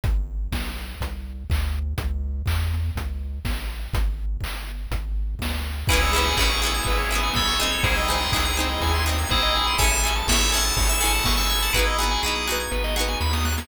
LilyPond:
<<
  \new Staff \with { instrumentName = "Electric Piano 2" } { \time 4/4 \key cis \minor \tempo 4 = 123 r1 | r1 | r1 | <e' gis'>4 <e' gis'>2 <a' cis''>4 |
<e' gis'>2. <e' gis'>4 | <e'' gis''>8 r8 <cis'' e''>8 <fis'' a''>8 <fis'' a''>16 <cis''' e'''>16 <fis'' a''>8. <a'' cis'''>16 <cis''' e'''>16 <fis'' a''>16 | <e' gis'>2 r2 | }
  \new Staff \with { instrumentName = "Harpsichord" } { \time 4/4 \key cis \minor r1 | r1 | r1 | <b cis' e' gis'>8 <b cis' e' gis'>8 <b cis' e' gis'>8 <b cis' e' gis'>4 <b cis' e' gis'>4 <bis dis' gis'>8~ |
<bis dis' gis'>8 <bis dis' gis'>8 <bis dis' gis'>8 <bis dis' gis'>4 <bis dis' gis'>4. | <cis' e' gis' a'>8 <cis' e' gis' a'>8 <cis' e' gis' a'>8 <cis' e' gis' a'>4 <cis' e' gis' a'>4. | <b dis' fis' gis'>8 <b dis' fis' gis'>8 <b dis' fis' gis'>8 <b dis' fis' gis'>4 <b dis' fis' gis'>4. | }
  \new Staff \with { instrumentName = "Drawbar Organ" } { \time 4/4 \key cis \minor r1 | r1 | r1 | b'16 cis''16 e''16 gis''16 b''16 cis'''16 e'''16 gis'''16 b'16 cis''16 e''16 gis''16 b''16 cis'''16 e'''16 gis'''16 |
bis'16 dis''16 gis''16 bis''16 dis'''16 gis'''16 bis'16 dis''16 gis''16 bis''16 dis'''16 gis'''16 bis'16 dis''16 gis''16 bis''16 | cis''16 e''16 gis''16 a''16 cis'''16 e'''16 gis'''16 a'''16 cis''16 e''16 gis''16 a''16 cis'''16 e'''16 gis'''16 a'''16 | b'16 dis''16 fis''16 gis''16 b''16 dis'''16 fis'''16 gis'''16 b'16 dis''16 fis''16 gis''16 b''16 dis'''16 fis'''16 gis'''16 | }
  \new Staff \with { instrumentName = "Synth Bass 1" } { \clef bass \time 4/4 \key cis \minor gis,,4 b,,4 bis,,4 d,4 | cis,4 e,4 cis,4 a,,4 | gis,,4 g,,4 gis,,4 d,4 | cis,4 a,,4 gis,,4 b,,4 |
bis,,4 cis,4 dis,4 ais,,4 | a,,4 gis,,4 gis,,4 g,,4 | gis,,4 b,,4 gis,,4 dis,4 | }
  \new Staff \with { instrumentName = "Drawbar Organ" } { \time 4/4 \key cis \minor r1 | r1 | r1 | <b cis' e' gis'>1 |
<bis dis' gis'>1 | <cis' e' gis' a'>1 | <b dis' fis' gis'>1 | }
  \new DrumStaff \with { instrumentName = "Drums" } \drummode { \time 4/4 <hh bd>4 <bd sn>8 sn8 <hh bd>4 <hc bd>4 | <hh bd>4 <hc bd>8 sn8 <hh bd>4 <bd sn>4 | <hh bd>4 <hc bd>8 sn8 <hh bd>4 <bd sn>4 | <cymc bd>8 cymr8 <hc bd>8 cymr8 <bd cymr>8 cymr8 <bd sn>8 cymr8 |
<bd cymr>8 cymr8 <hc bd>8 cymr8 <bd cymr>8 cymr8 <bd sn>8 cymr8 | <bd cymr>8 cymr8 <bd sn>8 cymr8 <bd cymr>8 cymr8 <bd sn>8 cymr8 | <bd sn>8 sn8 sn8 sn8 sn16 sn16 sn16 sn16 sn16 sn16 sn16 sn16 | }
>>